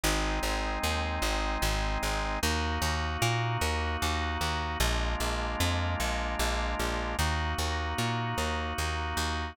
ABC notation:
X:1
M:3/4
L:1/8
Q:1/4=151
K:Ebdor
V:1 name="Drawbar Organ"
[A,CE]6- | [A,CE]6 | [B,EG]6- | [B,EG]6 |
[A,B,=DF]6- | [A,B,=DF]6 | [B,EG]6- | [B,EG]6 |]
V:2 name="Electric Bass (finger)" clef=bass
A,,,2 A,,,2 E,,2 | A,,,2 A,,,2 A,,,2 | E,,2 E,,2 B,,2 | E,,2 E,,2 E,,2 |
B,,,2 B,,,2 F,,2 | B,,,2 B,,,2 B,,,2 | E,,2 E,,2 B,,2 | E,,2 E,,2 E,,2 |]